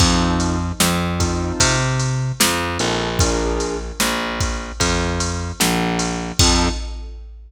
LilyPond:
<<
  \new Staff \with { instrumentName = "Acoustic Grand Piano" } { \time 4/4 \key f \major \tempo 4 = 75 <c' ees' f' a'>4. <c' ees' f' a'>2 <c' ees' f' a'>8 | <d' f' aes' bes'>1 | <c' ees' f' a'>4 r2. | }
  \new Staff \with { instrumentName = "Electric Bass (finger)" } { \clef bass \time 4/4 \key f \major f,4 f,4 c4 f,8 bes,,8~ | bes,,4 bes,,4 f,4 bes,,4 | f,4 r2. | }
  \new DrumStaff \with { instrumentName = "Drums" } \drummode { \time 4/4 <cymc bd>8 cymr8 sn8 <bd cymr>8 <bd cymr>8 cymr8 sn8 cymr8 | <bd cymr>8 cymr8 sn8 <bd cymr>8 <bd cymr>8 cymr8 sn8 cymr8 | <cymc bd>4 r4 r4 r4 | }
>>